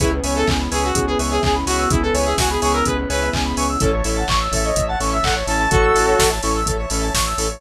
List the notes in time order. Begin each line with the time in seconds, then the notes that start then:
0.00 C#2 B3 C#4 E4 G#4 B4 C#5 E5 G#5, kick, closed hi-hat
0.12 B4
0.24 C#2 B4 C#5 E5 G#5, open hi-hat
0.36 A4 E5
0.47 C#2 G#5, kick, clap
0.60 B5
0.71 C#2 G#4 B4 C#5 E5 G#5 C#6, open hi-hat
0.83 F#4 E6
0.95 C#2 G#4, kick, closed hi-hat
1.07 G#4 B4
1.19 C#2 B4 C#5 E5 G#5, open hi-hat
1.31 G#4 E5
1.43 C#2 G#4 G#5, kick, clap
1.55 B5
1.66 C#2 F#4 B4 C#5 E5 G#5 C#6, open hi-hat
1.79 E6
1.90 C#2 E4 G#4, kick, closed hi-hat
2.02 A4 B4
2.14 C#2 B4 C#5 E5 G#5, open hi-hat
2.25 G#4 E5
2.38 C#2 F#4 G#5, kick, snare
2.50 G#4 B5
2.61 C#2 G#4 B4 C#5 E5 G#5 C#6, open hi-hat
2.73 A#4 E6
2.85 C#2 G#4 B4, kick, closed hi-hat
2.98 B4
3.09 C#2 B4 C#5 E5 G#5, open hi-hat
3.21 E5
3.33 C#2 G#5, kick, clap
3.45 B5
3.57 C#2 B4 C#5 E5 G#5 C#6, open hi-hat
3.69 E6
3.80 A1 C#4 E4 A4 C#5 E5 A5, kick, closed hi-hat
3.93 C#5
4.04 A1 C#4 E4 A4 E5, open hi-hat
4.17 F#5 A5
4.28 A1 C#6, kick, clap
4.40 E6
4.52 A1 C#4 E4 A4 E5, kick, open hi-hat
4.64 C#5 D#5
4.76 A1 E5, kick, closed hi-hat
4.88 F#5 A5
5.00 A1 C#4 E4 A4 C#6, open hi-hat
5.12 E5 E6
5.23 A1 A4 F#5, kick, clap
5.36 C#5
5.47 A1 C#4 E4 A4 E5 A5, open hi-hat
5.60 A5
5.70 A1 F#4 A4 C#6, kick, closed hi-hat
5.83 E6
5.95 A1 C#4 E4 A4, open hi-hat
6.07 C#5
6.19 A1 E5, kick, snare
6.31 A5
6.43 A1 C#4 E4 A4 C#6, open hi-hat
6.55 E6
6.66 A1 A4, kick, closed hi-hat
6.79 C#5
6.90 A1 C#4 E4 A4 E5, open hi-hat
7.02 A5
7.14 A1 C#6, kick, snare
7.26 E6
7.38 A1 C#4 E4 A4, open hi-hat
7.50 C#5